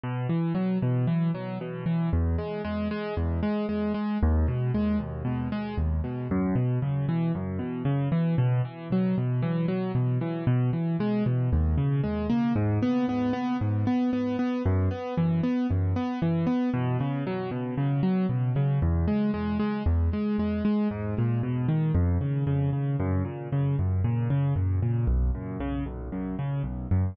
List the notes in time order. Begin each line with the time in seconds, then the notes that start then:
0.04 B2
0.29 E3
0.55 F#3
0.82 B2
1.07 E3
1.35 F#3
1.61 B2
1.86 E3
2.13 E2
2.38 G#3
2.65 G#3
2.91 G#3
3.17 E2
3.43 G#3
3.69 G#3
3.94 G#3
4.23 D#2
4.48 B2
4.74 G#3
4.99 D#2
5.25 B2
5.52 G#3
5.78 D#2
6.04 B2
6.31 F#2
6.55 B2
6.82 C#3
7.09 E3
7.35 F#2
7.59 B2
7.85 C#3
8.12 E3
8.38 B2
8.65 E3
8.92 F#3
9.18 B2
9.42 E3
9.68 F#3
9.95 B2
10.21 E3
10.47 B2
10.73 E3
11.00 G#3
11.26 B2
11.53 D#2
11.78 C#3
12.04 G#3
12.30 A#3
12.56 G#2
12.83 B3
13.09 B3
13.33 B3
13.61 G#2
13.87 B3
14.13 B3
14.39 B3
14.66 F#2
14.91 B3
15.17 E3
15.43 B3
15.71 F#2
15.96 B3
16.22 E3
16.47 B3
16.74 B2
17.01 C#3
17.27 F#3
17.51 B2
17.77 C#3
18.03 F#3
18.29 B2
18.56 C#3
18.82 E2
19.08 G#3
19.34 G#3
19.59 G#3
19.86 E2
20.13 G#3
20.39 G#3
20.65 G#3
20.91 G#2
21.18 A#2
21.43 B2
21.68 D#3
21.95 F2
22.21 C#3
22.47 C#3
22.73 C#3
23.00 F#2
23.25 A#2
23.52 C#3
23.79 F#2
24.04 A#2
24.30 C#3
24.56 F#2
24.82 A#2
25.07 B1
25.35 F#2
25.60 C#3
25.86 B1
26.12 F#2
26.39 C#3
26.63 B1
26.91 F#2